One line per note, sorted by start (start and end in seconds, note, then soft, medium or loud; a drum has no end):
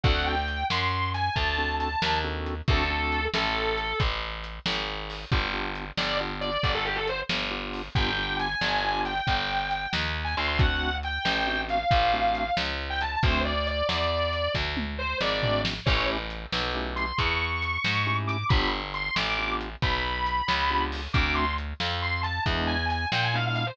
0.03 0.64 D2 medium
0.03 0.35 C4 medium
0.03 0.35 D4 medium
0.03 0.35 F#4 medium
0.03 0.35 A4 loud
0.03 0.24 F#5 loud
0.03 kick loud
0.03 closed hi-hat loud
0.26 0.65 G5 medium
0.48 closed hi-hat medium
0.70 1.29 F#2 medium
0.70 1.09 C6 medium
0.70 snare loud
1.14 1.33 G#5 medium
1.14 closed hi-hat medium
1.35 1.95 D2 medium
1.35 1.74 A5 medium
1.35 kick medium
1.35 closed hi-hat medium
1.58 1.89 C4 medium
1.58 1.89 D4 medium
1.58 1.89 F#4 medium
1.58 1.89 A4 medium
1.80 2.17 A5 medium
1.80 closed hi-hat medium
2.02 2.61 D#2 medium
2.02 snare loud
2.24 2.55 C4 medium
2.24 2.55 D4 medium
2.24 2.55 F#4 medium
2.24 2.55 A4 medium
2.46 closed hi-hat medium
2.68 3.27 D2 medium
2.68 2.83 C4 medium
2.68 2.83 D4 loud
2.68 2.83 F#4 loud
2.68 2.83 A4 loud
2.68 3.25 A4 loud
2.68 kick loud
2.68 closed hi-hat loud
2.90 3.21 C4 medium
2.90 3.21 D4 medium
2.90 3.21 F#4 medium
2.90 3.21 A4 medium
3.12 closed hi-hat medium
3.34 3.93 A1 medium
3.34 3.98 A4 medium
3.34 snare loud
3.78 closed hi-hat medium
4.00 4.59 A1 medium
4.00 kick medium
4.00 closed hi-hat loud
4.44 closed hi-hat medium
4.66 5.25 G#1 medium
4.66 snare loud
5.10 open hi-hat medium
5.32 5.91 G1 medium
5.32 5.47 B3 loud
5.32 5.47 D4 medium
5.32 5.47 F4 loud
5.32 5.47 G4 loud
5.32 kick loud
5.32 closed hi-hat loud
5.53 5.84 B3 medium
5.53 5.84 D4 medium
5.53 5.84 F4 medium
5.53 5.84 G4 medium
5.75 closed hi-hat medium
5.97 6.57 G1 medium
5.97 6.17 D5 medium
5.97 snare loud
6.20 6.50 B3 medium
6.20 6.50 D4 medium
6.20 6.50 F4 medium
6.20 6.50 G4 medium
6.41 6.70 D5 medium
6.41 closed hi-hat medium
6.63 7.23 G1 medium
6.63 kick medium
6.63 closed hi-hat medium
6.74 6.85 A4 medium
6.85 6.96 G4 medium
6.96 7.06 A4 medium
7.08 7.19 C5 medium
7.08 closed hi-hat medium
7.29 7.89 G1 medium
7.29 snare loud
7.51 7.82 B3 medium
7.51 7.82 D4 medium
7.51 7.82 F4 medium
7.51 7.82 G4 medium
7.73 open hi-hat medium
7.95 8.55 G1 medium
7.95 8.11 B3 loud
7.95 8.11 D4 medium
7.95 8.11 F4 medium
7.95 8.11 G4 loud
7.95 8.36 G5 loud
7.95 kick loud
7.95 closed hi-hat medium
8.17 8.48 B3 medium
8.17 8.48 D4 medium
8.17 8.48 F4 medium
8.17 8.48 G4 medium
8.39 9.00 G#5 medium
8.39 closed hi-hat medium
8.61 9.21 G1 medium
8.61 snare loud
8.84 9.14 B3 medium
8.84 9.14 D4 medium
8.84 9.14 F4 medium
8.84 9.14 G4 medium
9.05 9.90 G5 medium
9.05 closed hi-hat medium
9.27 9.87 G1 medium
9.27 kick medium
9.27 closed hi-hat loud
9.71 closed hi-hat medium
9.93 10.35 D#2 medium
9.93 snare loud
10.24 10.35 G#5 medium
10.37 11.19 D2 medium
10.37 10.48 C6 medium
10.37 closed hi-hat medium
10.48 10.59 C6 loud
10.58 10.90 A3 medium
10.58 10.90 C4 medium
10.58 10.90 D4 medium
10.58 10.90 F#4 loud
10.58 10.95 F#5 loud
10.58 kick loud
10.58 closed hi-hat loud
11.03 11.61 G5 medium
11.03 closed hi-hat medium
11.25 11.84 A1 medium
11.25 snare loud
11.47 11.78 A3 medium
11.47 11.78 C4 medium
11.47 11.78 D4 medium
11.47 11.78 F#4 medium
11.69 12.54 F5 medium
11.69 closed hi-hat medium
11.91 12.50 A1 medium
11.91 kick medium
11.91 closed hi-hat loud
12.13 12.44 A3 medium
12.13 12.44 C4 medium
12.13 12.44 D4 medium
12.13 12.44 F#4 medium
12.35 closed hi-hat medium
12.57 13.16 C#2 medium
12.57 snare loud
12.90 13.00 G5 medium
13.01 13.11 A5 medium
13.01 closed hi-hat medium
13.14 13.24 A5 medium
13.23 13.82 D2 medium
13.23 13.53 A3 loud
13.23 13.53 C4 loud
13.23 13.53 D4 loud
13.23 13.53 F#4 loud
13.23 13.40 C5 loud
13.23 kick loud
13.23 closed hi-hat loud
13.45 13.66 D5 medium
13.67 13.86 D5 medium
13.67 closed hi-hat medium
13.89 14.48 E2 medium
13.89 14.52 D5 medium
13.89 snare loud
14.33 closed hi-hat medium
14.55 15.14 D2 medium
14.55 kick medium
14.55 snare medium
14.77 high tom medium
14.98 15.18 C5 loud
15.21 15.80 G#1 medium
15.21 15.60 D5 medium
15.21 snare loud
15.43 15.74 A3 medium
15.43 15.74 C4 medium
15.43 15.74 D4 medium
15.43 15.74 F#4 medium
15.43 floor tom medium
15.65 snare loud
15.86 16.46 A1 medium
15.86 16.17 A3 loud
15.86 16.17 C#4 medium
15.86 16.17 E4 medium
15.86 16.17 G4 loud
15.86 16.06 C#5 loud
15.86 kick loud
15.86 crash loud
16.30 closed hi-hat medium
16.52 17.12 B1 medium
16.52 snare loud
16.74 17.05 A3 medium
16.74 17.05 C#4 medium
16.74 17.05 E4 medium
16.74 17.05 G4 medium
16.96 17.17 C6 medium
16.96 closed hi-hat medium
17.18 17.78 E2 medium
17.18 18.15 C#6 medium
17.18 kick medium
17.18 closed hi-hat loud
17.62 closed hi-hat medium
17.84 18.44 G#2 medium
17.84 snare loud
18.06 18.37 A3 medium
18.06 18.37 C#4 medium
18.06 18.37 E4 medium
18.06 18.37 G4 medium
18.27 18.46 D6 medium
18.27 closed hi-hat medium
18.49 19.10 G1 medium
18.49 18.81 B3 loud
18.49 18.81 D4 medium
18.49 18.81 F4 loud
18.49 18.81 G4 loud
18.49 18.67 B5 loud
18.49 kick loud
18.49 closed hi-hat loud
18.94 19.15 C6 medium
18.94 closed hi-hat medium
19.16 19.76 A1 medium
19.16 19.52 D6 medium
19.16 snare loud
19.38 19.69 B3 medium
19.38 19.69 D4 medium
19.38 19.69 F4 medium
19.38 19.69 G4 medium
19.61 closed hi-hat medium
19.82 20.42 B1 medium
19.82 20.81 B5 medium
19.82 kick medium
19.82 closed hi-hat loud
20.26 closed hi-hat medium
20.48 21.08 C#2 medium
20.48 snare loud
20.70 21.01 B3 medium
20.70 21.01 D4 medium
20.70 21.01 F4 medium
20.70 21.01 G4 medium
20.92 open hi-hat medium
21.13 21.73 D2 medium
21.13 21.45 A3 loud
21.13 21.45 C4 medium
21.13 21.45 D4 loud
21.13 21.45 F#4 loud
21.13 21.34 D6 medium
21.13 kick loud
21.13 closed hi-hat loud
21.35 21.53 C6 medium
21.58 closed hi-hat medium
21.80 22.39 F2 medium
21.80 snare loud
22.02 22.21 C6 medium
22.23 22.42 A5 medium
22.23 closed hi-hat medium
22.46 23.05 E2 medium
22.46 22.77 G#3 loud
22.46 22.77 B3 loud
22.46 22.77 D4 loud
22.46 22.77 E4 loud
22.46 kick medium
22.46 closed hi-hat loud
22.67 22.86 G#5 loud
22.89 23.06 G#5 medium
22.89 closed hi-hat medium
23.12 23.71 A#2 medium
23.12 23.23 G5 medium
23.12 snare loud
23.24 23.35 G#5 medium
23.34 23.64 G#3 medium
23.34 23.64 B3 medium
23.34 23.64 D4 medium
23.34 23.64 E4 medium
23.34 23.45 F5 medium
23.46 23.55 F5 medium
23.55 23.66 F5 loud
23.55 closed hi-hat medium
23.66 23.77 C5 medium